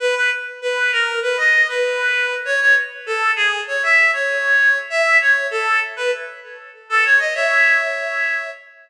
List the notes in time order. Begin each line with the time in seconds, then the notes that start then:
0.00 B4
0.16 B4
0.62 B4
0.92 A#4
1.22 B4
1.37 D#5
1.68 B4
2.45 C#5
2.60 C#5
3.06 A4
3.36 G#4
3.67 C#5
3.83 E5
4.13 C#5
4.90 E5
5.21 C#5
5.51 A4
5.97 B4
6.90 A4
7.05 C#5
7.19 D#5
7.34 C#5 E5